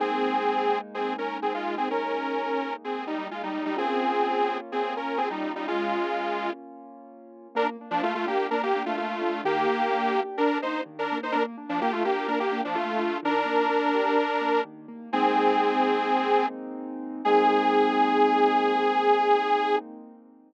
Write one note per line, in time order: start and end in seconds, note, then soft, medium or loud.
0.00 3.70 G#3 medium
0.00 3.70 A#3 medium
0.00 0.79 C4 medium
0.00 3.70 D#4 medium
0.00 0.79 G#4 medium
0.94 1.14 C4 medium
0.94 1.14 G#4 medium
1.18 1.38 C#4 soft
1.18 1.38 A#4 medium
1.42 1.53 C4 soft
1.42 1.53 G#4 medium
1.54 1.75 G#3 medium
1.54 1.75 F4 medium
1.78 1.89 C4 medium
1.78 1.89 G#4 medium
1.90 2.74 C#4 medium
1.90 2.74 A#4 medium
2.84 3.05 C4 soft
2.84 3.05 G#4 soft
3.07 3.28 G3 soft
3.07 3.28 D#4 medium
3.31 3.42 G#3 soft
3.31 3.42 F4 soft
3.43 3.65 G3 soft
3.43 3.65 D#4 medium
3.65 3.77 G3 medium
3.65 3.77 D#4 medium
3.77 7.47 A#3 medium
3.77 4.58 C4 medium
3.77 7.47 C#4 medium
3.77 7.47 F4 medium
3.77 4.58 G#4 medium
4.72 4.94 C4 medium
4.72 4.94 G#4 medium
4.97 5.18 C#4 soft
4.97 5.18 A#4 medium
5.18 5.29 C4 medium
5.18 5.29 G#4 medium
5.30 5.52 G3 soft
5.30 5.52 D#4 medium
5.56 5.67 G3 medium
5.56 5.67 D#4 medium
5.68 6.51 G#3 medium
5.68 6.51 F4 medium
7.55 7.76 A#3 loud
7.55 7.67 D4 medium
7.55 7.67 A#4 medium
7.81 8.02 D4 medium
7.91 8.02 F3 medium
7.91 8.02 D4 medium
8.02 8.14 A3 medium
8.02 8.23 F4 medium
8.02 8.14 F4 medium
8.15 8.26 A3 medium
8.15 8.26 F4 medium
8.26 8.47 A#3 medium
8.26 8.47 D4 medium
8.26 8.47 G4 medium
8.51 8.72 A#3 medium
8.51 8.62 D4 medium
8.51 8.62 A#4 medium
8.63 8.83 A#3 medium
8.63 8.83 G4 medium
8.75 8.97 D4 medium
8.86 8.96 A3 medium
8.86 8.96 F4 medium
8.97 9.41 A3 medium
8.97 9.41 F4 medium
8.97 9.19 F4 medium
9.21 9.42 D4 medium
9.44 9.66 D#3 loud
9.44 10.21 A#3 medium
9.44 10.21 G4 medium
9.68 9.89 A#3 medium
9.91 10.12 D4 medium
10.15 10.37 G4 medium
10.38 10.58 D4 medium
10.38 10.61 D4 medium
10.38 10.58 A#4 medium
10.62 10.84 A#3 medium
10.62 10.81 D#4 medium
10.62 10.81 C5 medium
10.86 11.07 D#3 medium
10.99 11.18 D4 medium
10.99 11.18 A#4 medium
11.12 11.33 A#3 medium
11.23 11.34 D#4 medium
11.23 11.34 C5 medium
11.32 11.56 A#3 loud
11.32 11.43 D4 medium
11.32 11.43 A#4 medium
11.58 11.79 D4 medium
11.69 11.80 F3 medium
11.69 11.80 D4 medium
11.81 11.92 A#3 medium
11.81 12.02 F4 medium
11.81 11.92 G4 medium
11.92 12.03 A3 medium
11.92 12.03 F4 medium
12.05 12.27 A#3 medium
12.05 12.26 D4 medium
12.05 12.27 G4 medium
12.28 12.50 A#3 medium
12.28 12.39 D4 medium
12.28 12.39 A#4 medium
12.40 12.61 A#3 medium
12.40 12.61 G4 medium
12.52 12.73 D4 medium
12.64 12.76 F3 medium
12.64 12.76 D4 medium
12.75 13.18 A3 medium
12.75 13.18 F4 medium
12.75 12.98 F4 medium
12.99 13.20 D4 medium
13.23 13.44 D#3 loud
13.23 14.61 D4 medium
13.23 14.61 A#4 medium
13.45 13.66 A#3 medium
13.70 13.91 D4 medium
13.95 14.16 G4 medium
14.18 14.39 D4 medium
14.41 14.62 A#3 medium
14.65 14.86 D#3 medium
14.88 15.10 A#3 medium
15.13 17.21 G#3 medium
15.13 17.21 A#3 medium
15.13 16.46 C4 medium
15.13 17.21 C4 medium
15.13 17.21 D#4 medium
15.13 16.46 G#4 medium
17.25 19.77 G#3 medium
17.25 19.77 A#3 medium
17.25 19.77 C4 loud
17.25 19.77 D#4 loud
17.25 19.76 G#4 loud